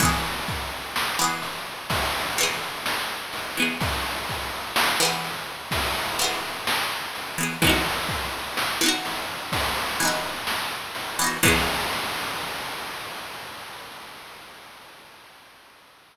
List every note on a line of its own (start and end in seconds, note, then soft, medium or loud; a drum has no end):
0.00 0.76 E3 medium
0.00 0.76 B3 medium
0.00 kick loud
0.00 ride loud
0.05 0.76 G#4 medium
0.47 kick medium
0.47 ride medium
0.96 snare loud
1.19 1.95 E3 medium
1.19 1.95 B3 medium
1.24 1.95 G#4 medium
1.42 ride medium
1.90 kick medium
1.90 ride loud
2.37 3.14 E3 medium
2.37 3.14 B3 medium
2.37 ride medium
2.43 3.14 G#4 medium
2.86 snare loud
3.33 ride medium
3.57 4.34 E3 medium
3.57 4.34 B3 medium
3.62 4.34 G#4 medium
3.81 kick loud
3.81 ride loud
4.29 kick medium
4.29 ride medium
4.76 snare loud
5.00 5.76 E3 medium
5.00 5.76 B3 medium
5.05 5.76 G#4 medium
5.24 ride medium
5.71 kick medium
5.71 ride loud
6.19 6.95 E3 medium
6.19 6.95 B3 medium
6.19 snare soft
6.19 ride medium
6.24 6.95 G#4 medium
6.67 snare loud
7.15 ride medium
7.38 7.57 E3 medium
7.38 7.57 B3 medium
7.43 7.57 G#4 medium
7.62 8.38 E3 medium
7.62 8.38 B3 medium
7.62 kick loud
7.62 ride loud
7.67 8.38 D#4 medium
7.67 8.38 F#4 medium
8.09 kick medium
8.09 ride medium
8.57 snare loud
8.81 9.57 E3 medium
8.81 9.57 B3 medium
8.86 9.57 D#4 medium
8.86 9.57 F#4 medium
9.05 ride medium
9.52 kick medium
9.52 ride loud
10.00 10.76 E3 medium
10.00 10.76 B3 medium
10.00 ride medium
10.05 10.76 D#4 medium
10.05 10.76 F#4 medium
10.47 snare loud
10.95 ride medium
11.19 11.38 E3 medium
11.19 11.38 B3 medium
11.24 11.38 D#4 medium
11.24 11.38 F#4 medium
11.43 14.99 E3 loud
11.43 14.99 B3 medium
11.43 kick loud
11.43 crash loud
11.48 14.99 G#4 loud